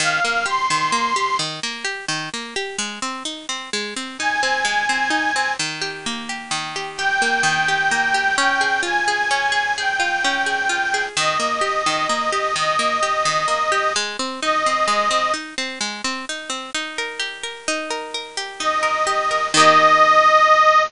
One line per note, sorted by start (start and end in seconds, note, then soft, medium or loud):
0.00 0.20 D#3 loud
0.00 0.45 F5 medium
0.25 0.45 A#3 medium
0.46 0.67 G4 medium
0.46 1.37 C6 medium
0.70 0.91 D#3 medium
0.92 1.13 A#3 medium
1.16 1.37 G4 medium
1.39 1.60 D#3 medium
1.63 1.84 A#3 medium
1.84 2.05 G4 medium
2.08 2.29 D#3 medium
2.34 2.54 A#3 medium
2.56 2.77 G4 medium
2.78 2.99 G#3 loud
3.02 3.23 C4 medium
3.25 3.46 D#4 medium
3.49 3.70 C4 medium
3.73 3.94 G#3 medium
3.96 4.17 C4 medium
4.18 4.41 D#4 medium
4.18 5.52 G#5 medium
4.43 4.64 C4 medium
4.65 4.86 G#3 medium
4.89 5.10 C4 medium
5.10 5.31 D#4 medium
5.36 5.57 C4 medium
5.59 6.50 D#3 medium
5.81 6.29 G4 medium
6.06 7.21 A#3 medium
6.29 6.75 G4 medium
6.51 7.43 D#3 medium
6.76 6.98 G4 medium
6.97 7.68 G4 medium
6.97 8.36 G5 medium
7.22 7.91 A#3 medium
7.43 8.31 D#3 medium
7.68 8.14 G4 medium
7.91 8.36 A#3 medium
8.14 8.36 G4 medium
8.37 9.30 C#4 loud
8.37 8.81 G5 medium
8.61 9.07 G#4 medium
8.83 9.99 F4 medium
8.83 9.73 G#5 medium
9.08 9.51 G#4 medium
9.31 10.24 C#4 medium
9.52 9.77 G#4 medium
9.77 10.46 G#4 medium
9.77 11.04 G5 medium
10.00 10.69 F4 medium
10.24 11.13 C#4 medium
10.46 10.93 G#4 medium
10.69 11.14 F4 medium
10.94 11.16 G#4 medium
11.16 11.38 D#3 loud
11.16 12.55 D#5 medium
11.40 11.60 A#3 medium
11.61 11.82 G4 medium
11.86 12.07 D#3 medium
12.09 12.30 A#3 medium
12.32 12.53 G4 medium
12.55 12.77 D#3 medium
12.55 13.92 D#5 medium
12.79 13.00 A#3 medium
13.03 13.24 G4 medium
13.25 13.46 D#3 medium
13.48 13.69 A#3 medium
13.72 13.93 G4 medium
13.96 14.17 G#3 loud
14.19 14.40 C4 medium
14.42 14.63 D#4 medium
14.42 15.32 D#5 medium
14.66 14.87 C4 medium
14.88 15.09 G#3 medium
15.11 15.31 C4 medium
15.34 15.55 D#4 medium
15.58 15.79 C4 medium
15.81 16.02 G#3 medium
16.04 16.25 C4 medium
16.29 16.50 D#4 medium
16.50 16.71 C4 medium
16.74 17.67 D#4 medium
16.98 17.43 A#4 medium
17.19 18.37 G4 medium
17.43 17.90 A#4 medium
17.68 18.60 D#4 loud
17.90 18.14 A#4 medium
18.14 18.82 A#4 medium
18.37 19.06 G4 medium
18.59 19.49 D#4 medium
18.59 19.47 D#5 medium
18.83 19.30 A#4 medium
19.07 19.51 G4 medium
19.31 19.53 A#4 medium
19.54 20.83 D#3 loud
19.54 20.83 A#3 loud
19.54 20.82 D#5 loud
19.60 20.83 G4 loud